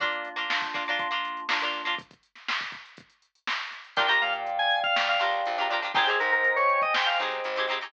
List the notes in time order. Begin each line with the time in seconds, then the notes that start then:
0.00 A#3 D4 F4, kick, closed hi-hat
0.12 closed hi-hat
0.25 closed hi-hat
0.36 A#3 D4 F4, closed hi-hat
0.50 A#3 D4 F4, snare
0.62 kick, closed hi-hat
0.74 A#3 D4 F4, kick, closed hi-hat
0.87 A#3 D4 F4, closed hi-hat
0.99 A#3 D4 F4, kick, closed hi-hat
1.11 A#3 D4 F4, closed hi-hat
1.25 closed hi-hat
1.37 closed hi-hat
1.49 A#3 D4 F4, snare
1.61 A#3 D4 F4, closed hi-hat
1.73 closed hi-hat
1.85 A#3 D4 F4, open hi-hat
1.98 kick, closed hi-hat
2.11 kick, closed hi-hat
2.23 closed hi-hat
2.35 snare, closed hi-hat
2.48 snare
2.60 kick, closed hi-hat
2.72 kick, closed hi-hat
2.85 closed hi-hat
2.97 kick, closed hi-hat
3.10 closed hi-hat
3.22 closed hi-hat
3.35 closed hi-hat
3.47 snare
3.60 closed hi-hat
3.71 snare, closed hi-hat
3.85 closed hi-hat
3.96 A#1 D4 F4 G4 A#4 D5 F5 G5, kick, closed hi-hat
4.08 D4 F4 G4 A#4 A#5, closed hi-hat
4.21 A#2 F5, closed hi-hat
4.33 closed hi-hat
4.47 closed hi-hat
4.59 G#5, closed hi-hat
4.71 closed hi-hat
4.84 F5, kick, closed hi-hat
4.96 A#2 F5, snare
5.08 F5, closed hi-hat
5.19 C#2 D4 F4 G4 A#4, closed hi-hat
5.33 closed hi-hat
5.46 A#1, closed hi-hat
5.58 D4 F4 G4 A#4, closed hi-hat
5.70 D4 F4 G4 A#4, snare, closed hi-hat
5.82 D4 F4 G4 A#4, closed hi-hat
5.95 G#1 C4 D#4 G4 G#4 C5 D#5 G5 G#5, kick, closed hi-hat
6.07 C4 D#4 G4 G#4, closed hi-hat
6.19 G#2 A#4, snare, closed hi-hat
6.32 A#4, closed hi-hat
6.44 closed hi-hat
6.56 C#5, snare, closed hi-hat
6.69 closed hi-hat
6.82 D#5, kick, closed hi-hat
6.94 G#2 G5, snare
7.06 F5, closed hi-hat
7.19 B1 C4 D#4 G4 G#4, closed hi-hat
7.32 closed hi-hat
7.44 G#1, closed hi-hat
7.56 C4 D#4 G4 G#4, closed hi-hat
7.68 C4 D#4 G4 G#4, closed hi-hat
7.81 C4 D#4 G4 G#4, closed hi-hat